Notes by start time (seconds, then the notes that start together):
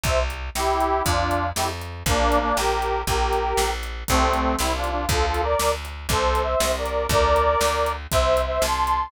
0.04 C2 C5 E5, kick, closed hi-hat
0.30 closed hi-hat
0.55 C2 E4 G4, snare
0.80 closed hi-hat
1.04 F2 D4 F4, kick, closed hi-hat
1.31 closed hi-hat
1.55 F2 E4 G4, snare
1.81 closed hi-hat
2.06 A#1 A#3 D4, kick, closed hi-hat
2.32 closed hi-hat
2.41 A#3 D4
2.56 A#1 G4 A#4, snare
2.82 closed hi-hat
3.07 A#1 G4 A#4, kick, closed hi-hat
3.33 closed hi-hat
3.57 A#1, snare
3.83 closed hi-hat
4.08 C2 A3 C4, kick, closed hi-hat
4.34 closed hi-hat
4.59 C2 C4 E4, snare
4.76 D4 F4
4.84 closed hi-hat
4.91 D4 F4
5.09 D2 F4 A4, kick, closed hi-hat
5.26 F4 A4
5.34 closed hi-hat
5.43 A#4 D5
5.59 D2, snare
5.85 closed hi-hat
6.09 C2 A4 C5, kick, closed hi-hat
6.35 closed hi-hat
6.43 C5 E5
6.60 C2, snare
6.78 A#4 D5
6.86 closed hi-hat
7.09 D2 A#4 D5, kick, closed hi-hat
7.36 closed hi-hat
7.61 D2, snare
7.86 closed hi-hat
8.11 C2 C5 E5, kick, closed hi-hat
8.37 closed hi-hat
8.46 C5 E5
8.62 C2 A5 C6, snare
8.87 closed hi-hat